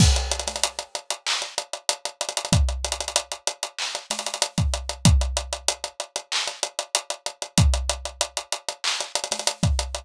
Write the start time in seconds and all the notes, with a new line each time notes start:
0.00 kick, crash
0.16 closed hi-hat
0.31 closed hi-hat
0.39 closed hi-hat
0.47 snare, closed hi-hat
0.56 closed hi-hat
0.63 closed hi-hat
0.79 closed hi-hat
0.95 closed hi-hat
1.10 closed hi-hat
1.27 clap
1.42 closed hi-hat
1.58 closed hi-hat
1.73 closed hi-hat
1.89 closed hi-hat
2.05 closed hi-hat
2.21 closed hi-hat
2.29 closed hi-hat
2.37 closed hi-hat
2.45 closed hi-hat
2.53 kick, closed hi-hat
2.69 closed hi-hat
2.84 closed hi-hat
2.92 closed hi-hat
3.00 closed hi-hat
3.08 closed hi-hat
3.16 closed hi-hat
3.32 closed hi-hat
3.47 closed hi-hat
3.63 closed hi-hat
3.79 clap
3.95 closed hi-hat
4.10 snare, closed hi-hat
4.19 closed hi-hat
4.26 closed hi-hat
4.34 closed hi-hat
4.42 closed hi-hat
4.58 kick, closed hi-hat
4.74 closed hi-hat
4.89 closed hi-hat
5.05 kick, closed hi-hat
5.21 closed hi-hat
5.37 closed hi-hat
5.53 closed hi-hat
5.68 closed hi-hat
5.84 closed hi-hat
6.00 closed hi-hat
6.16 closed hi-hat
6.32 clap
6.48 closed hi-hat
6.63 closed hi-hat
6.79 closed hi-hat
6.95 closed hi-hat
7.10 closed hi-hat
7.26 closed hi-hat
7.42 closed hi-hat
7.58 kick, closed hi-hat
7.74 closed hi-hat
7.89 closed hi-hat
8.05 closed hi-hat
8.21 closed hi-hat
8.37 closed hi-hat
8.52 closed hi-hat
8.69 closed hi-hat
8.84 clap
9.00 closed hi-hat
9.15 closed hi-hat
9.24 closed hi-hat
9.31 snare, closed hi-hat
9.39 closed hi-hat
9.47 closed hi-hat
9.63 kick, closed hi-hat
9.79 closed hi-hat
9.94 closed hi-hat